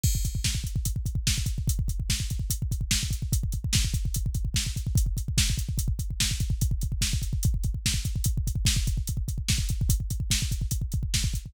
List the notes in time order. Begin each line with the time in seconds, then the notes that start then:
0.04 kick, crash
0.15 kick
0.25 kick, closed hi-hat
0.35 kick
0.44 kick, snare
0.55 kick
0.64 kick, closed hi-hat
0.76 kick
0.85 kick, closed hi-hat
0.96 kick
1.06 kick, closed hi-hat
1.15 kick
1.27 kick, snare
1.38 kick
1.46 kick, closed hi-hat
1.58 kick
1.68 kick, closed hi-hat
1.79 kick
1.88 kick, closed hi-hat
2.00 kick
2.10 kick, snare
2.20 kick
2.30 kick, closed hi-hat
2.39 kick
2.50 kick, closed hi-hat
2.62 kick
2.71 kick, closed hi-hat
2.81 kick
2.91 kick, snare
3.03 kick
3.11 kick, closed hi-hat
3.22 kick
3.32 kick, closed hi-hat
3.43 kick
3.52 kick, closed hi-hat
3.64 kick
3.73 kick, snare
3.85 kick
3.94 kick, closed hi-hat
4.05 kick
4.14 kick, closed hi-hat
4.26 kick
4.35 kick, closed hi-hat
4.45 kick
4.54 kick, snare
4.66 kick
4.76 kick, closed hi-hat
4.87 kick
4.95 kick, closed hi-hat
5.06 kick
5.17 kick, closed hi-hat
5.28 kick
5.38 kick, snare
5.50 kick
5.58 kick, closed hi-hat
5.69 kick
5.78 kick, closed hi-hat
5.88 kick
5.99 kick, closed hi-hat
6.11 kick
6.20 kick, snare
6.31 kick
6.40 kick, closed hi-hat
6.50 kick
6.61 kick, closed hi-hat
6.71 kick
6.81 kick, closed hi-hat
6.92 kick
7.01 kick, snare
7.13 kick
7.22 kick, closed hi-hat
7.33 kick
7.43 kick, closed hi-hat
7.54 kick
7.64 kick, closed hi-hat
7.74 kick
7.86 kick, snare
7.94 kick
8.05 kick, closed hi-hat
8.16 kick
8.24 kick, closed hi-hat
8.38 kick
8.47 kick, closed hi-hat
8.55 kick
8.65 kick, snare
8.76 kick
8.87 kick, closed hi-hat
8.97 kick
9.07 kick, closed hi-hat
9.17 kick
9.28 kick, closed hi-hat
9.38 kick
9.48 kick, snare
9.58 kick
9.69 kick, closed hi-hat
9.81 kick
9.89 kick, closed hi-hat
10.00 kick
10.10 kick, closed hi-hat
10.20 kick
10.30 kick, snare
10.42 kick
10.51 kick, closed hi-hat
10.61 kick
10.71 kick, closed hi-hat
10.82 kick
10.92 kick, closed hi-hat
11.03 kick
11.14 kick, snare
11.24 kick
11.34 kick, closed hi-hat
11.46 kick